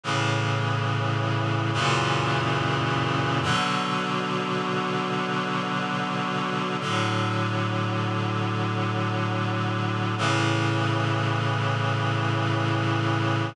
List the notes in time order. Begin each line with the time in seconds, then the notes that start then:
0.04 A2 C#3 E3
1.73 F#2 A#2 C#3 E3
3.42 B2 D3 F#3
6.80 A2 D3 F#3
10.18 A2 C#3 E3